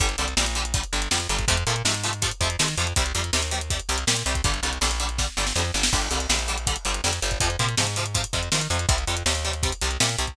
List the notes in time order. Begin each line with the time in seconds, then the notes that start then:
0.00 G1 D3 G3, kick, closed hi-hat
0.09 closed hi-hat
0.18 C2 D3 G3, closed hi-hat
0.28 closed hi-hat
0.37 A#1 D3 G3, snare
0.46 closed hi-hat
0.55 D3 G3, closed hi-hat
0.65 closed hi-hat
0.74 D3 G3, kick, closed hi-hat
0.84 closed hi-hat
0.93 G1 D3 G3, closed hi-hat
1.02 closed hi-hat
1.11 F2 D3 G3, snare
1.20 closed hi-hat
1.29 G1 D3 G3, closed hi-hat
1.39 kick, closed hi-hat
1.48 F2 C3 F3 A3, kick, closed hi-hat
1.57 closed hi-hat
1.67 A#2 C3 F3 A3, closed hi-hat
1.76 closed hi-hat
1.85 G#2 C3 F3 A3, snare
1.94 closed hi-hat
2.04 C3 F3 A3, closed hi-hat
2.13 closed hi-hat
2.22 C3 F3 A3, kick, closed hi-hat
2.31 closed hi-hat
2.41 F2 C3 F3 A3, kick, closed hi-hat
2.50 closed hi-hat
2.59 C3 D#3 F3 A3, snare
2.68 closed hi-hat
2.78 F2 C3 F3 A3, closed hi-hat
2.87 closed hi-hat
2.96 C2 C3 G3, kick, closed hi-hat
3.06 closed hi-hat
3.15 F2 C3 G3, closed hi-hat
3.24 closed hi-hat
3.33 D#2 C3 G3, snare
3.43 closed hi-hat
3.51 C3 G3, closed hi-hat
3.61 closed hi-hat
3.70 C3 G3, kick, closed hi-hat
3.80 closed hi-hat
3.89 C2 C3 G3, closed hi-hat
3.98 closed hi-hat
4.07 A#2 C3 G3, snare
4.17 closed hi-hat
4.26 C2 C3 G3, closed hi-hat
4.35 kick, closed hi-hat
4.44 G1 D3 G3, kick, closed hi-hat
4.54 closed hi-hat
4.63 C2 D3 G3, closed hi-hat
4.73 closed hi-hat
4.81 A#1 D3 G3, snare
4.91 closed hi-hat
5.00 D3 G3, closed hi-hat
5.09 closed hi-hat
5.18 D3 G3, kick, snare
5.37 G1 D3 G3, snare
5.47 snare
5.56 F2 D3 G3, snare
5.74 G1 D3 G3, snare
5.83 snare
5.93 G1 D3 G3, kick, crash
6.02 closed hi-hat
6.11 C2 D3 G3, closed hi-hat
6.20 closed hi-hat
6.29 A#1 D3 G3, snare
6.39 closed hi-hat
6.48 D3 G3, closed hi-hat
6.58 closed hi-hat
6.67 D3 G3, kick, closed hi-hat
6.76 closed hi-hat
6.85 G1 D3 G3, closed hi-hat
6.94 closed hi-hat
7.04 F2 D3 G3, snare
7.13 closed hi-hat
7.22 G1 D3 G3, closed hi-hat
7.31 kick, closed hi-hat
7.40 F2 C3 F3, kick, closed hi-hat
7.50 closed hi-hat
7.59 A#2 C3 F3, closed hi-hat
7.69 closed hi-hat
7.77 G#2 C3 F3, snare
7.87 closed hi-hat
7.96 C3 F3, closed hi-hat
8.06 closed hi-hat
8.14 C3 F3, kick, closed hi-hat
8.24 closed hi-hat
8.33 F2 C3 F3, kick, closed hi-hat
8.43 closed hi-hat
8.52 C3 D#3 F3, snare
8.61 closed hi-hat
8.70 F2 C3 F3, closed hi-hat
8.79 closed hi-hat
8.89 C2 C3 G3, kick, closed hi-hat
8.98 closed hi-hat
9.07 F2 C3 G3, closed hi-hat
9.17 closed hi-hat
9.26 D#2 C3 G3, snare
9.35 closed hi-hat
9.45 C3 G3, closed hi-hat
9.53 closed hi-hat
9.63 C3 G3, kick, closed hi-hat
9.72 closed hi-hat
9.81 C2 C3 G3, closed hi-hat
9.91 closed hi-hat
10.00 A#2 C3 G3, snare
10.09 closed hi-hat
10.18 C2 C3 G3, closed hi-hat
10.27 kick, closed hi-hat